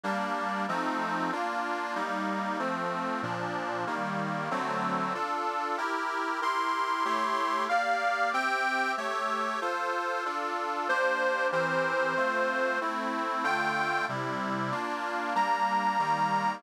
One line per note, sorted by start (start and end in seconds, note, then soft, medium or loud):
0.04 0.66 G3 medium
0.04 0.66 A#3 medium
0.04 0.66 D4 medium
0.68 1.31 F3 medium
0.68 1.31 A3 medium
0.68 1.31 C4 medium
0.68 1.31 D#4 medium
1.32 1.95 A#3 medium
1.32 1.95 D4 medium
1.32 1.95 F4 medium
1.95 2.58 G3 medium
1.95 2.58 A#3 medium
1.95 2.58 D#4 medium
2.59 3.21 F3 medium
2.59 3.21 A3 medium
2.59 3.21 C4 medium
3.23 3.85 A#2 medium
3.23 3.85 F3 medium
3.23 3.85 D4 medium
3.87 4.49 D#3 medium
3.87 4.49 G3 medium
3.87 4.49 A#3 medium
4.51 5.13 D3 medium
4.51 5.13 F#3 medium
4.51 5.13 A3 medium
4.51 5.13 C4 medium
5.14 5.77 D4 medium
5.14 5.77 F4 medium
5.14 5.77 A4 medium
5.77 6.40 E4 medium
5.77 6.40 G4 medium
5.77 6.40 A#4 medium
6.41 7.04 E4 medium
6.41 7.04 G4 medium
6.41 7.04 A#4 medium
6.41 7.64 C6 medium
7.05 7.68 A3 medium
7.05 7.68 E4 medium
7.05 7.68 G4 loud
7.05 7.68 C#5 medium
7.69 8.33 A#3 medium
7.69 8.33 G4 medium
7.69 8.33 D5 medium
7.69 8.30 F5 medium
8.33 8.96 C4 medium
8.33 8.96 G4 loud
8.33 8.96 E5 medium
8.33 8.92 G5 medium
8.97 9.60 A3 medium
8.97 9.60 G4 medium
8.97 9.60 C#5 loud
8.97 9.60 E5 medium
9.61 10.24 F4 loud
9.61 10.24 A4 medium
9.61 10.24 C5 medium
10.25 10.88 D4 medium
10.25 10.88 F4 medium
10.25 10.88 A4 medium
10.89 11.52 A#3 medium
10.89 11.52 D4 medium
10.89 11.52 G4 medium
10.89 11.47 C5 medium
11.52 12.15 E3 medium
11.52 12.15 C4 medium
11.52 12.15 G4 medium
11.52 12.15 A#4 medium
11.52 12.79 C5 medium
12.16 12.79 A3 medium
12.16 12.79 C4 medium
12.16 12.79 F4 medium
12.81 13.43 A3 medium
12.81 13.44 C4 medium
12.81 13.44 E4 medium
13.43 14.06 D3 medium
13.43 14.06 A3 loud
13.43 14.06 F4 loud
13.43 14.05 G5 medium
14.09 14.71 C3 medium
14.09 14.71 G3 medium
14.09 14.71 E4 medium
14.72 15.34 A#3 medium
14.72 15.34 D4 medium
14.72 15.34 F4 medium
15.35 15.98 G3 medium
15.35 15.98 A#3 loud
15.35 15.98 D4 medium
15.35 16.55 A#5 medium
15.99 16.62 D#3 medium
15.99 16.62 G3 loud
15.99 16.62 A#3 medium